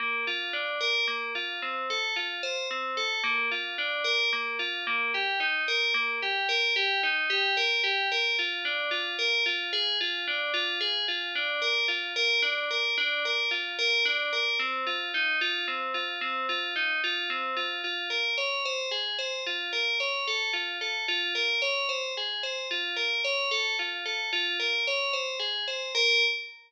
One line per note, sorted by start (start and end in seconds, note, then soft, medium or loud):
0.00 0.25 A#3 medium
0.27 0.52 F4 medium
0.53 0.78 D4 medium
0.81 1.05 A#4 medium
1.08 1.32 A#3 medium
1.35 1.60 F4 medium
1.62 1.87 C4 medium
1.90 2.15 A4 medium
2.16 2.41 F4 medium
2.43 2.68 C5 medium
2.71 2.96 C4 medium
2.97 3.22 A4 medium
3.24 3.48 A#3 medium
3.51 3.76 F4 medium
3.78 4.03 D4 medium
4.04 4.29 A#4 medium
4.33 4.58 A#3 medium
4.59 4.84 F4 medium
4.87 5.12 A#3 medium
5.14 5.39 G4 medium
5.40 5.65 D#4 medium
5.68 5.93 A#4 medium
5.94 6.19 A#3 medium
6.22 6.47 G4 medium
6.49 6.74 A#4 medium
6.76 7.01 G4 medium
7.03 7.28 D#4 medium
7.30 7.55 G4 medium
7.57 7.82 A#4 medium
7.84 8.08 G4 medium
8.12 8.36 A#4 medium
8.39 8.64 F4 medium
8.65 8.90 D4 medium
8.91 9.16 F4 medium
9.19 9.44 A#4 medium
9.46 9.71 F4 medium
9.73 9.98 G#4 medium
10.01 10.25 F4 medium
10.28 10.52 D4 medium
10.54 10.78 F4 medium
10.81 11.05 G#4 medium
11.08 11.33 F4 medium
11.35 11.60 D4 medium
11.62 11.87 A#4 medium
11.88 12.13 F4 medium
12.16 12.41 A#4 medium
12.42 12.67 D4 medium
12.71 12.95 A#4 medium
12.98 13.23 D4 medium
13.25 13.50 A#4 medium
13.51 13.76 F4 medium
13.79 14.03 A#4 medium
14.05 14.30 D4 medium
14.33 14.58 A#4 medium
14.59 14.84 C4 medium
14.87 15.11 F4 medium
15.14 15.39 D#4 medium
15.41 15.66 F4 medium
15.68 15.93 C4 medium
15.94 16.19 F4 medium
16.21 16.46 C4 medium
16.49 16.74 F4 medium
16.76 17.01 D#4 medium
17.04 17.29 F4 medium
17.30 17.55 C4 medium
17.57 17.81 F4 medium
17.84 18.09 F4 medium
18.10 18.35 A#4 medium
18.38 18.63 C#5 medium
18.65 18.90 C5 medium
18.91 19.16 G#4 medium
19.19 19.43 C5 medium
19.47 19.71 F4 medium
19.73 19.98 A#4 medium
20.00 20.25 C#5 medium
20.27 20.52 A4 medium
20.53 20.78 F4 medium
20.81 21.06 A4 medium
21.08 21.33 F4 medium
21.35 21.60 A#4 medium
21.62 21.87 C#5 medium
21.89 22.14 C5 medium
22.17 22.42 G#4 medium
22.43 22.68 C5 medium
22.71 22.96 F4 medium
22.96 23.21 A#4 medium
23.24 23.49 C#5 medium
23.51 23.76 A4 medium
23.79 24.04 F4 medium
24.06 24.30 A4 medium
24.33 24.58 F4 medium
24.60 24.84 A#4 medium
24.87 25.12 C#5 medium
25.13 25.38 C5 medium
25.40 25.64 G#4 medium
25.68 25.92 C5 medium
25.95 26.23 A#4 loud